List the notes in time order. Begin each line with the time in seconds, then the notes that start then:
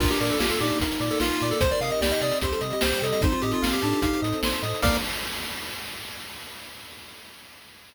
0.00 A#1 A#3 D4 F4 A#4, kick, crash
0.10 G4, closed hi-hat
0.20 A#2 A#4 D5, closed hi-hat
0.30 A4, closed hi-hat
0.39 A#1 F4 G4 F5, snare
0.49 A4, closed hi-hat
0.60 A#2 D#4 G4 D5, closed hi-hat
0.70 closed hi-hat
0.80 A#1 A#3 F4 A#4, kick, closed hi-hat
0.92 closed hi-hat
1.00 A#2 D5, closed hi-hat
1.11 A4, closed hi-hat
1.20 A#1 F4 F5, snare
1.31 closed hi-hat
1.41 A#2 D5, closed hi-hat
1.51 A4, closed hi-hat
1.61 C2 C4 D#4 G4 C5, kick, closed hi-hat
1.71 A#4 D5, closed hi-hat
1.80 C3 A#4 D#5 F5, closed hi-hat
1.90 D#5, closed hi-hat
2.01 C2 G4 D5 G5, snare
2.12 D#5, closed hi-hat
2.21 C3 D5 D#5, closed hi-hat
2.32 closed hi-hat
2.41 C2 G3 C4 G4 C5, kick, closed hi-hat
2.51 A4, closed hi-hat
2.61 C3 D#5, closed hi-hat
2.70 G4 D#5, closed hi-hat
2.81 C2 G4 C5 G5, snare
2.91 G4, closed hi-hat
3.02 C3 A4 D#5, closed hi-hat
3.12 D#5, closed hi-hat
3.21 A1 C4 D#4 F4 A4 C5, kick, closed hi-hat
3.32 F4, closed hi-hat
3.42 A2 G4 D#5, closed hi-hat
3.51 F4, closed hi-hat
3.62 A1 F5, snare
3.72 G4, closed hi-hat
3.82 A2 D4 A5, closed hi-hat
3.92 closed hi-hat
4.02 A1 C4 D#4 A4 C5 F5, kick, closed hi-hat
4.13 closed hi-hat
4.22 A2 D#5, closed hi-hat
4.32 closed hi-hat
4.43 A1 C5, snare
4.53 closed hi-hat
4.62 A2 D#5, closed hi-hat
4.74 closed hi-hat
4.82 A#1 A#3 D4 F4 A#4 D5 F5, kick, crash